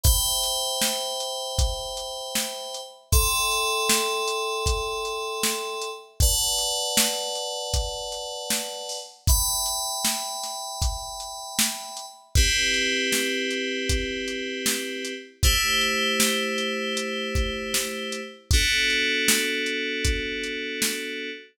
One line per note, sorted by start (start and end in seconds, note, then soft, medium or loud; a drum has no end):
0.03 2.80 C5 medium
0.03 2.80 E5 loud
0.03 2.80 G5 medium
0.03 2.80 B5 medium
0.03 kick loud
0.03 closed hi-hat loud
0.43 closed hi-hat medium
0.81 snare loud
1.20 closed hi-hat medium
1.58 kick loud
1.58 closed hi-hat loud
1.97 closed hi-hat medium
2.35 snare loud
2.74 closed hi-hat medium
3.12 5.89 A4 loud
3.12 5.89 E5 medium
3.12 5.89 G5 medium
3.12 5.89 C6 medium
3.12 kick loud
3.12 closed hi-hat loud
3.51 closed hi-hat medium
3.89 snare loud
4.28 closed hi-hat loud
4.66 kick loud
4.66 closed hi-hat loud
5.05 closed hi-hat medium
5.43 snare loud
5.81 closed hi-hat medium
6.20 8.98 B4 medium
6.20 8.98 D5 medium
6.20 8.98 F#5 medium
6.20 8.98 A5 medium
6.20 kick loud
6.20 closed hi-hat loud
6.58 closed hi-hat medium
6.97 snare loud
7.35 closed hi-hat medium
7.74 kick loud
7.74 closed hi-hat loud
8.12 closed hi-hat medium
8.50 snare loud
8.89 open hi-hat medium
9.27 12.05 E5 medium
9.27 12.05 G5 medium
9.27 12.05 B5 loud
9.27 kick loud
9.27 closed hi-hat loud
9.66 closed hi-hat medium
10.04 snare loud
10.43 snare soft
10.43 closed hi-hat medium
10.82 kick loud
10.82 closed hi-hat loud
11.20 closed hi-hat medium
11.59 snare loud
11.97 closed hi-hat medium
12.35 15.13 C4 medium
12.35 15.13 E4 medium
12.35 15.13 G4 medium
12.35 15.13 B4 medium
12.35 kick loud
12.35 closed hi-hat loud
12.74 closed hi-hat medium
13.12 snare loud
13.50 closed hi-hat medium
13.89 kick loud
13.89 closed hi-hat loud
14.28 closed hi-hat medium
14.66 snare loud
15.04 closed hi-hat medium
15.43 18.20 A3 medium
15.43 18.20 E4 medium
15.43 18.20 G4 medium
15.43 18.20 C5 medium
15.43 kick loud
15.43 closed hi-hat loud
15.81 closed hi-hat medium
16.20 snare loud
16.58 closed hi-hat medium
16.97 closed hi-hat loud
17.35 kick loud
17.35 closed hi-hat medium
17.74 snare loud
18.12 closed hi-hat medium
18.51 21.30 B3 medium
18.51 21.30 D4 medium
18.51 21.30 F#4 loud
18.51 21.30 A4 medium
18.51 kick loud
18.51 closed hi-hat loud
18.90 closed hi-hat medium
19.28 snare loud
19.66 closed hi-hat medium
20.04 kick loud
20.04 closed hi-hat loud
20.43 closed hi-hat medium
20.82 snare loud